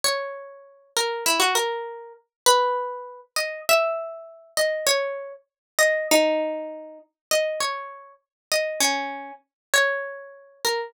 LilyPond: \new Staff { \time 2/4 \key b \major \tempo 4 = 99 cis''4. ais'8 | e'16 fis'16 ais'4 r8 | \key gis \minor b'4. dis''8 | e''4. dis''8 |
cis''8. r8. dis''8 | dis'4. r8 | \key b \major dis''8 cis''4 r8 | dis''8 cis'4 r8 |
cis''4. ais'8 | }